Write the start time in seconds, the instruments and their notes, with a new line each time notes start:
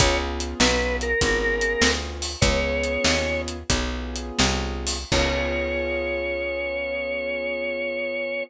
0.00 electric bass (finger) C#2, acoustic grand piano B3 C#4 F4 G#4, drawbar organ C#5, kick, closed hi-hat
0.40 closed hi-hat
0.60 electric bass (finger) B1, drawbar organ B4, snare
1.01 drawbar organ A#4, closed hi-hat
1.21 electric bass (finger) G#1, acoustic grand piano B3 C#4 F4 G#4, kick, closed hi-hat
1.61 closed hi-hat
1.81 electric bass (finger) D2, snare
2.22 open hi-hat
2.41 electric bass (finger) C#2, acoustic grand piano B3 C#4 F4 G#4, drawbar organ C#5, kick, closed hi-hat
2.83 closed hi-hat
3.04 electric bass (finger) D#2, snare
3.48 closed hi-hat
3.70 electric bass (finger) B1, acoustic grand piano B3 C#4 F4 G#4, kick, closed hi-hat
4.16 closed hi-hat
4.39 electric bass (finger) C2, snare
4.87 open hi-hat
5.12 electric bass (finger) C#2, acoustic grand piano B3 C#4 F4 G#4, drawbar organ C#5, kick, crash